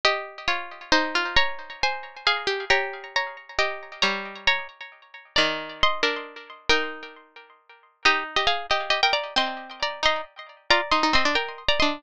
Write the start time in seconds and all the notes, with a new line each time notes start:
0.05 G4 D#5
0.48 F4 C#5
0.92 D#4 C5
1.15 F4
1.36 C#5 A#5
1.83 C5 G#5
2.27 G#4 F5
2.47 G4
2.70 G4 C#5 A#5
3.16 C#5 A#5
3.59 G4 D#5
4.02 G3 C#5 A#5
4.47 C#5 A#5
5.36 D#3 D5 A#5
5.83 D#5 C6
6.03 D4 A#4
6.69 D#4 A#4 G5
8.05 D#4 G4 D#5
8.36 G4 D#5
8.47 G#4 F5
8.71 G4 D#5
8.90 G4 D#5
9.03 A#4 G5
9.13 D5 A#5
9.36 C4 D#5 C6
9.83 D5 A#5
10.03 D#4 D#5 C6
10.70 F4 D5 A#5
10.91 D#4 D#5 C6
11.03 D#4
11.13 C4 D#5 C6
11.25 D4
11.35 A#4 G5
11.69 D5 A#5
11.80 D4 D#5 C6